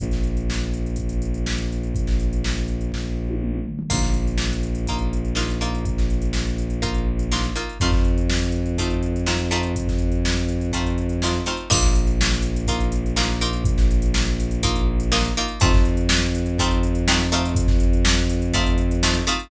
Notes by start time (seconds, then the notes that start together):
0.00 A#1, kick, closed hi-hat
0.11 snare, closed hi-hat
0.23 closed hi-hat
0.37 closed hi-hat
0.50 snare
0.61 closed hi-hat
0.74 closed hi-hat
0.86 closed hi-hat
0.96 kick, closed hi-hat
1.09 closed hi-hat
1.22 closed hi-hat
1.34 closed hi-hat
1.46 snare
1.58 closed hi-hat
1.72 closed hi-hat
1.83 closed hi-hat
1.95 kick, closed hi-hat
2.07 snare, closed hi-hat
2.20 closed hi-hat
2.33 closed hi-hat
2.44 snare
2.58 closed hi-hat
2.68 closed hi-hat
2.81 closed hi-hat
2.92 kick, snare
3.29 high tom
3.41 mid tom
3.55 mid tom
3.65 floor tom
3.79 floor tom
3.90 A#1 A#3 D#4 F4, kick, crash
4.02 snare, closed hi-hat
4.14 closed hi-hat
4.27 closed hi-hat
4.38 snare
4.53 closed hi-hat
4.63 closed hi-hat
4.75 closed hi-hat
4.87 A#3 D#4 F4, kick, closed hi-hat
4.98 closed hi-hat
5.13 closed hi-hat
5.25 closed hi-hat
5.35 A#3 D#4 F4, snare
5.48 snare, closed hi-hat
5.61 A#3 D#4 F4, closed hi-hat
5.75 closed hi-hat
5.85 kick, closed hi-hat
5.98 snare, closed hi-hat
6.10 closed hi-hat
6.22 closed hi-hat
6.33 snare
6.46 closed hi-hat
6.58 closed hi-hat
6.70 closed hi-hat
6.82 A#3 D#4 F4, kick, closed hi-hat
6.95 closed hi-hat
7.19 closed hi-hat
7.32 A#3 D#4 F4, snare
7.44 closed hi-hat
7.56 A#3 D#4 F4, closed hi-hat
7.69 closed hi-hat
7.80 F2 A3 C4 D#4 F4, kick, closed hi-hat
7.92 kick, snare, closed hi-hat
8.04 closed hi-hat
8.18 closed hi-hat
8.30 snare
8.42 closed hi-hat
8.52 closed hi-hat
8.66 closed hi-hat
8.78 A3 C4 D#4 F4, kick, closed hi-hat
8.90 closed hi-hat
9.03 closed hi-hat
9.16 closed hi-hat
9.26 A3 C4 D#4 F4, snare
9.39 closed hi-hat
9.51 A3 C4 D#4 F4, closed hi-hat
9.63 closed hi-hat
9.76 kick, closed hi-hat
9.88 kick, snare, closed hi-hat
9.99 closed hi-hat
10.12 closed hi-hat
10.25 snare
10.36 closed hi-hat
10.49 closed hi-hat
10.61 closed hi-hat
10.72 A3 C4 D#4 F4, kick, closed hi-hat
10.87 closed hi-hat
10.98 closed hi-hat
11.09 closed hi-hat
11.22 A3 C4 D#4 F4, snare
11.33 closed hi-hat
11.46 A3 C4 D#4 F4, closed hi-hat
11.57 closed hi-hat
11.70 A#1 A#3 D#4 F4, kick, crash
11.83 snare, closed hi-hat
11.95 closed hi-hat
12.07 closed hi-hat
12.21 snare
12.32 closed hi-hat
12.42 closed hi-hat
12.56 closed hi-hat
12.67 A#3 D#4 F4, kick, closed hi-hat
12.80 closed hi-hat
12.92 closed hi-hat
13.06 closed hi-hat
13.16 A#3 D#4 F4, snare
13.30 snare, closed hi-hat
13.41 A#3 D#4 F4, closed hi-hat
13.53 closed hi-hat
13.65 kick, closed hi-hat
13.78 snare, closed hi-hat
13.91 closed hi-hat
14.02 closed hi-hat
14.14 snare
14.27 closed hi-hat
14.40 closed hi-hat
14.51 closed hi-hat
14.63 A#3 D#4 F4, kick, closed hi-hat
14.76 closed hi-hat
15.00 closed hi-hat
15.12 A#3 D#4 F4, snare
15.24 closed hi-hat
15.37 A#3 D#4 F4, closed hi-hat
15.48 closed hi-hat
15.60 F2 A3 C4 D#4 F4, kick, closed hi-hat
15.73 kick, snare, closed hi-hat
15.85 closed hi-hat
15.97 closed hi-hat
16.09 snare
16.22 closed hi-hat
16.35 closed hi-hat
16.46 closed hi-hat
16.59 A3 C4 D#4 F4, kick, closed hi-hat
16.71 closed hi-hat
16.83 closed hi-hat
16.95 closed hi-hat
17.08 A3 C4 D#4 F4, snare
17.20 closed hi-hat
17.32 A3 C4 D#4 F4, closed hi-hat
17.45 closed hi-hat
17.55 kick, closed hi-hat
17.67 kick, snare, closed hi-hat
17.80 closed hi-hat
17.93 closed hi-hat
18.05 snare
18.18 closed hi-hat
18.30 closed hi-hat
18.42 closed hi-hat
18.53 A3 C4 D#4 F4, kick, closed hi-hat
18.66 closed hi-hat
18.78 closed hi-hat
18.91 closed hi-hat
19.03 A3 C4 D#4 F4, snare
19.14 closed hi-hat
19.27 A3 C4 D#4 F4, closed hi-hat
19.39 closed hi-hat